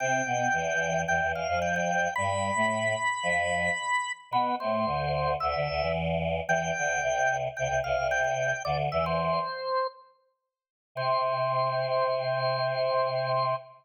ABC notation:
X:1
M:4/4
L:1/16
Q:1/4=111
K:C
V:1 name="Drawbar Organ"
g8 g2 f2 g g3 | b16 | B2 c6 e4 z4 | g8 g2 f2 g g3 |
"^rit." d z e c7 z6 | c16 |]
V:2 name="Choir Aahs"
[C,C]2 [B,,B,]2 [E,,E,]4 [E,,E,] [E,,E,] [E,,E,] [F,,F,]5 | [G,,G,]3 [A,,A,]3 z2 [F,,F,]4 z4 | [B,,B,]2 [A,,A,]2 [D,,D,]4 [D,,D,] [D,,D,] [D,,D,] [E,,E,]5 | [E,,E,]2 [D,,D,]2 [C,,C,]4 [C,,C,] [C,,C,] [C,,C,] [C,,C,]5 |
"^rit." [D,,D,]2 [E,,E,]4 z10 | C,16 |]